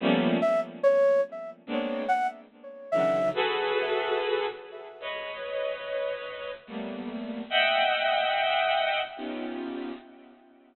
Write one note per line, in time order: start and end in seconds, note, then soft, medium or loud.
0.00 0.38 F3 loud
0.00 0.38 G3 loud
0.00 0.38 A3 loud
0.00 0.38 A#3 loud
0.00 0.38 B3 loud
0.00 0.38 C#4 loud
0.42 0.60 E5 medium
0.83 1.21 C#5 medium
1.67 2.04 G#3 medium
1.67 2.04 A#3 medium
1.67 2.04 B3 medium
1.67 2.04 C4 medium
1.67 2.04 D4 medium
2.08 2.27 F#5 medium
2.92 3.30 C#3 soft
2.92 3.30 D3 soft
2.92 3.30 D#3 soft
2.92 3.30 E3 soft
2.92 3.30 F#3 soft
2.92 3.30 G#3 soft
2.92 3.29 E5 medium
3.34 4.46 F#4 loud
3.34 4.46 G#4 loud
3.34 4.46 A4 loud
3.34 4.46 B4 loud
5.00 6.50 B4 medium
5.00 6.50 C#5 medium
5.00 6.50 D#5 medium
6.67 7.42 G3 medium
6.67 7.42 A3 medium
6.67 7.42 A#3 medium
6.67 7.42 B3 medium
7.50 9.00 D#5 loud
7.50 9.00 E5 loud
7.50 9.00 F#5 loud
7.50 9.00 G5 loud
9.16 9.91 B3 medium
9.16 9.91 C#4 medium
9.16 9.91 D#4 medium
9.16 9.91 F4 medium
9.16 9.91 G4 medium